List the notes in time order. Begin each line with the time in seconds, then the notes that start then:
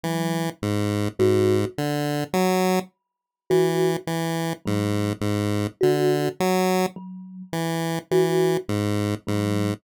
0.03 E3 F#3
0.62 G#2
1.19 G#2 F#4
1.78 D3
2.33 F#3
3.50 E3 F#4
4.07 E3
4.65 G#2 F#3
5.21 G#2
5.81 D3 F#4
6.40 F#3
6.96 F#3
7.53 E3
8.11 E3 F#4
8.69 G#2
9.27 G#2 F#3